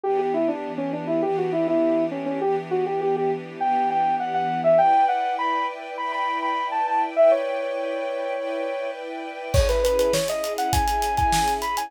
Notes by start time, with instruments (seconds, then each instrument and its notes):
0.04 string ensemble 1 E3 B3 D4 G4, lead 2 (sawtooth) G4
0.19 lead 2 (sawtooth) G4
0.34 lead 2 (sawtooth) E4
0.48 lead 2 (sawtooth) D4
0.78 lead 2 (sawtooth) C#4
0.93 lead 2 (sawtooth) D4
1.07 lead 2 (sawtooth) E4
1.22 string ensemble 1 E3 B3 D4 G4, lead 2 (sawtooth) G4
1.38 lead 2 (sawtooth) F#4
1.52 lead 2 (sawtooth) E4
1.68 lead 2 (sawtooth) E4
2.11 lead 2 (sawtooth) C#4
2.26 lead 2 (sawtooth) C#4
2.41 string ensemble 1 E3 B3 D4 G4, lead 2 (sawtooth) G4
2.71 lead 2 (sawtooth) F#4
2.86 lead 2 (sawtooth) G4
3.01 lead 2 (sawtooth) G4
3.16 lead 2 (sawtooth) G4
3.60 string ensemble 1 E3 B3 D4 G4, lead 2 (sawtooth) G5
3.90 lead 2 (sawtooth) G5
4.20 lead 2 (sawtooth) F#5
4.34 lead 2 (sawtooth) F#5
4.64 lead 2 (sawtooth) E5
4.78 string ensemble 1 E4 B4 D5 G5, lead 2 (sawtooth) G5
5.08 lead 2 (sawtooth) F#5
5.39 lead 2 (sawtooth) B5
5.98 string ensemble 1 E4 B4 D5 G5, lead 2 (sawtooth) B5
6.12 lead 2 (sawtooth) B5
6.42 lead 2 (sawtooth) B5
6.72 lead 2 (sawtooth) A5
6.87 lead 2 (sawtooth) A5
7.16 string ensemble 1 E4 B4 D5 G5, lead 2 (sawtooth) E5
7.31 lead 2 (sawtooth) C#5
8.35 string ensemble 1 E4 B4 D5 G5
9.54 string ensemble 1 C#4 E4 G#4, lead 2 (sawtooth) C#5, kick, crash
9.69 lead 2 (sawtooth) B4, snare, closed hi-hat
9.84 lead 2 (sawtooth) B4, closed hi-hat
9.99 lead 2 (sawtooth) B4, closed hi-hat
10.13 lead 2 (sawtooth) C#5, snare
10.28 lead 2 (sawtooth) D#5, closed hi-hat
10.44 closed hi-hat
10.58 lead 2 (sawtooth) F#5, closed hi-hat
10.73 lead 2 (sawtooth) G#5, kick, closed hi-hat
10.88 closed hi-hat
11.02 closed hi-hat
11.17 lead 2 (sawtooth) G#5, kick, closed hi-hat
11.33 snare
11.48 closed hi-hat
11.62 lead 2 (sawtooth) B5, closed hi-hat
11.77 lead 2 (sawtooth) G#5, closed hi-hat